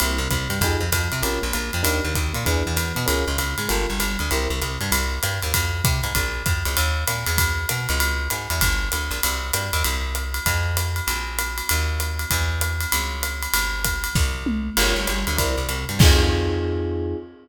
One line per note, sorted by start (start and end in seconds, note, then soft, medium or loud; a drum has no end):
0.00 0.18 C2 loud
0.00 0.18 A#3 medium
0.00 0.18 C4 medium
0.00 0.18 E4 medium
0.00 0.18 G4 medium
0.00 ride medium
0.18 0.28 C2 medium
0.18 0.29 C3 medium
0.30 0.48 C2 medium
0.30 0.46 C3 medium
0.30 kick medium
0.30 hi-hat pedal medium
0.30 ride medium
0.49 0.60 G2 medium
0.49 0.59 G3 medium
0.49 ride medium
0.61 0.77 F2 loud
0.61 0.81 D#4 medium
0.61 0.81 F4 medium
0.61 0.81 G4 medium
0.61 0.81 G#4 medium
0.61 kick medium
0.61 ride medium
0.80 0.90 F2 medium
0.80 0.92 F3 medium
0.92 1.08 F2 medium
0.92 1.09 F3 medium
0.92 kick soft
0.92 hi-hat pedal medium
0.92 ride medium
1.12 1.22 C3 medium
1.12 1.22 C4 medium
1.12 ride medium
1.22 1.39 A#1 medium
1.22 1.40 C#4 medium
1.22 1.40 F4 medium
1.22 1.40 G4 medium
1.22 1.40 A#4 medium
1.22 ride medium
1.42 1.53 A#1 medium
1.42 1.51 A#3 medium
1.53 1.71 A#1 medium
1.53 1.70 A#3 medium
1.53 hi-hat pedal medium
1.53 ride medium
1.73 1.84 F2 medium
1.73 1.83 F3 medium
1.73 ride medium
1.83 2.00 D#2 medium
1.83 2.00 D4 medium
1.83 2.00 D#4 medium
1.83 2.00 G4 medium
1.83 2.00 A#4 medium
1.83 ride medium
2.04 2.14 D#2 medium
2.04 2.14 D#3 medium
2.15 2.33 D#2 medium
2.15 2.32 D#3 medium
2.15 kick medium
2.15 hi-hat pedal medium
2.15 ride medium
2.33 2.45 A#2 medium
2.33 2.43 A#3 medium
2.33 ride medium
2.45 2.63 E2 loud
2.45 2.63 D4 medium
2.45 2.63 E4 medium
2.45 2.63 G#4 medium
2.45 2.63 B4 medium
2.45 kick soft
2.45 ride medium
2.66 2.76 E2 medium
2.66 2.76 E3 medium
2.76 2.93 E2 medium
2.76 2.93 E3 medium
2.76 hi-hat pedal medium
2.76 ride medium
2.95 3.06 B2 medium
2.95 3.05 B3 medium
2.95 ride medium
3.06 3.25 C#2 medium
3.06 3.24 C#4 medium
3.06 3.24 F4 medium
3.06 3.24 G#4 medium
3.06 3.24 A#4 medium
3.06 ride medium
3.27 3.37 C#2 medium
3.27 3.38 C#3 medium
3.38 3.55 C#2 medium
3.38 3.55 C#3 medium
3.38 hi-hat pedal medium
3.38 ride medium
3.58 3.68 G#2 medium
3.58 3.68 G#3 medium
3.58 ride medium
3.69 3.86 G1 loud
3.69 3.86 F4 medium
3.69 3.86 G4 medium
3.69 3.86 A4 medium
3.69 3.86 A#4 medium
3.69 ride medium
3.89 3.99 G1 medium
3.89 3.98 G3 medium
3.99 4.17 G1 medium
3.99 4.16 G3 medium
3.99 hi-hat pedal medium
3.99 ride medium
4.19 4.30 D2 medium
4.19 4.29 D3 medium
4.19 ride medium
4.31 4.48 C2 loud
4.31 4.48 E4 medium
4.31 4.48 G4 medium
4.31 4.48 A#4 medium
4.31 4.48 C5 medium
4.31 ride medium
4.50 4.60 C2 medium
4.50 4.60 C3 medium
4.60 4.78 C2 medium
4.60 4.77 C3 medium
4.60 hi-hat pedal medium
4.60 ride medium
4.81 4.91 G2 medium
4.81 4.91 G3 medium
4.81 ride medium
4.92 5.19 C2 loud
4.92 ride medium
5.23 5.40 G2 medium
5.23 hi-hat pedal medium
5.23 ride medium
5.42 5.53 D#2 medium
5.42 ride medium
5.54 5.82 F2 medium
5.54 kick medium
5.54 ride medium
5.84 6.01 C3 medium
5.84 kick medium
5.84 hi-hat pedal medium
5.84 ride medium
6.03 6.13 G#2 medium
6.03 ride medium
6.15 6.43 A#1 medium
6.15 kick medium
6.15 ride medium
6.46 6.63 F2 medium
6.46 kick medium
6.46 hi-hat pedal medium
6.46 ride medium
6.65 6.76 C#2 medium
6.65 ride medium
6.77 7.04 D#2 loud
6.77 ride medium
7.07 7.25 A#2 medium
7.07 hi-hat pedal medium
7.07 ride medium
7.26 7.66 E2 loud
7.26 ride medium
7.38 kick medium
7.38 ride loud
7.69 7.87 B2 medium
7.69 hi-hat pedal medium
7.69 ride medium
7.89 8.28 C#2 loud
7.89 ride medium
8.00 ride medium
8.30 8.48 G#2 medium
8.30 hi-hat pedal medium
8.30 ride medium
8.50 8.60 E2 loud
8.50 ride medium
8.61 8.89 G1 loud
8.61 kick medium
8.61 ride loud
8.92 9.10 D2 medium
8.92 hi-hat pedal medium
8.92 ride medium
9.11 9.20 A#1 medium
9.11 ride medium
9.23 9.51 C2 medium
9.23 ride loud
9.53 9.71 G2 medium
9.53 hi-hat pedal medium
9.53 ride medium
9.73 9.83 D#2 loud
9.73 ride medium
9.84 10.40 C2 medium
9.84 ride medium
10.15 hi-hat pedal medium
10.15 ride medium
10.34 ride medium
10.46 11.01 F2 medium
10.46 kick soft
10.46 ride medium
10.77 hi-hat pedal medium
10.77 ride medium
10.96 ride medium
11.07 11.62 A#1 medium
11.07 ride medium
11.39 hi-hat pedal medium
11.39 ride medium
11.58 ride medium
11.69 12.25 D#2 loud
11.69 ride medium
12.00 hi-hat pedal medium
12.00 ride medium
12.19 ride medium
12.31 12.86 E2 loud
12.31 kick medium
12.31 ride medium
12.61 hi-hat pedal medium
12.61 ride medium
12.81 ride medium
12.92 13.48 C#2 medium
12.92 ride medium
13.23 hi-hat pedal medium
13.23 ride medium
13.42 ride medium
13.53 14.08 G1 medium
13.53 ride loud
13.84 kick soft
13.84 hi-hat pedal medium
13.84 ride medium
14.04 ride medium
14.15 14.70 C2 loud
14.15 kick medium
14.15 snare medium
14.46 mid tom medium
14.77 14.94 G1 loud
14.77 14.95 F4 medium
14.77 14.95 G4 medium
14.77 14.95 A#4 medium
14.77 14.95 C#5 medium
14.77 crash medium
14.77 ride medium
14.96 15.06 G1 medium
14.96 15.06 G3 medium
15.07 15.25 G1 medium
15.07 15.24 G3 medium
15.07 hi-hat pedal medium
15.07 ride medium
15.27 15.37 D2 medium
15.27 15.37 D3 medium
15.27 ride medium
15.37 15.56 C2 loud
15.37 15.54 E4 medium
15.37 15.54 A#4 medium
15.37 15.54 C5 medium
15.37 15.54 D5 medium
15.37 kick medium
15.37 ride medium
15.56 15.67 C2 medium
15.56 15.66 C3 medium
15.69 15.85 C2 medium
15.69 15.86 C3 medium
15.69 hi-hat pedal medium
15.69 ride medium
15.89 15.99 G2 medium
15.89 15.99 G3 medium
15.89 ride medium
15.99 17.14 F2 loud
15.99 17.16 C4 medium
15.99 17.16 D#4 medium
15.99 17.16 F4 medium
15.99 17.16 G#4 medium
15.99 kick loud
15.99 crash loud